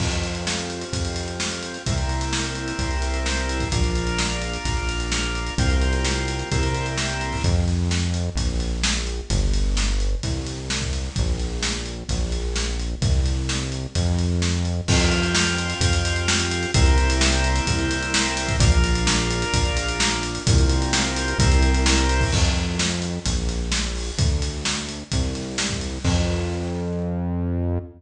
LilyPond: <<
  \new Staff \with { instrumentName = "Drawbar Organ" } { \time 4/4 \key f \major \tempo 4 = 129 <c' f' g'>1 | <bes c' e' g'>1 | <bes d' f'>1 | <bes c' f' g'>2 <bes c' e' g'>2 |
r1 | r1 | r1 | r1 |
<c' f' g'>1 | <bes c' e' g'>1 | <bes d' f'>1 | <bes c' f' g'>2 <bes c' e' g'>2 |
r1 | r1 | r1 | }
  \new Staff \with { instrumentName = "Synth Bass 1" } { \clef bass \time 4/4 \key f \major f,2 f,2 | c,2 c,2 | bes,,2 bes,,2 | c,2 c,2 |
f,2 bes,,2 | g,,2 c,2 | bes,,2 bes,,2 | c,2 f,2 |
f,2 f,2 | c,2 c,2 | bes,,2 bes,,2 | c,2 c,2 |
f,2 bes,,2 | d,2 c,2 | f,1 | }
  \new DrumStaff \with { instrumentName = "Drums" } \drummode { \time 4/4 <cymc bd>16 hh16 hh16 hh16 sn16 hh16 hh16 hh16 <hh bd>16 hh16 hh16 hh16 sn16 hh16 hh16 hh16 | <hh bd>16 hh16 hh16 hh16 sn16 hh16 hh16 hh16 <hh bd>16 hh16 hh16 hh16 sn16 hh16 hh16 <hh bd>16 | <hh bd>16 hh16 hh16 hh16 sn16 hh16 hh16 hh16 <hh bd>16 hh16 hh16 hh16 sn16 hh16 hh16 hh16 | <hh bd>16 hh16 hh16 hh16 sn16 hh16 hh16 hh16 <hh bd>16 hh16 hh16 hh16 sn16 hh16 hh16 <hho bd>16 |
<hh bd>8 hh8 sn8 hh8 <hh bd>8 hh8 sn8 hh8 | <hh bd>8 hh8 sn8 hh8 <hh bd>8 hh8 sn16 bd16 hh8 | <hh bd>8 hh8 sn8 hh8 <hh bd>8 hh8 sn8 hh8 | <hh bd>8 hh8 sn8 hh8 <hh bd>8 hh8 sn8 hh8 |
<cymc bd>16 hh16 hh16 hh16 sn16 hh16 hh16 hh16 <hh bd>16 hh16 hh16 hh16 sn16 hh16 hh16 hh16 | <hh bd>16 hh16 hh16 hh16 sn16 hh16 hh16 hh16 <hh bd>16 hh16 hh16 hh16 sn16 hh16 hh16 <hh bd>16 | <hh bd>16 hh16 hh16 hh16 sn16 hh16 hh16 hh16 <hh bd>16 hh16 hh16 hh16 sn16 hh16 hh16 hh16 | <hh bd>16 hh16 hh16 hh16 sn16 hh16 hh16 hh16 <hh bd>16 hh16 hh16 hh16 sn16 hh16 hh16 <hho bd>16 |
<cymc bd>8 hh8 sn8 hh8 <hh bd>8 hh8 sn8 hho8 | <hh bd>8 hh8 sn8 hh8 <hh bd>8 hh8 sn16 bd16 hh8 | <cymc bd>4 r4 r4 r4 | }
>>